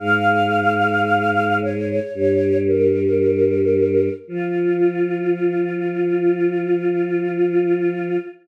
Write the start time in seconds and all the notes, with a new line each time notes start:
0.00 G#2 G#3 F5
1.61 C#5
2.14 G2 G3 C#5
2.67 A#4
4.27 F3 F4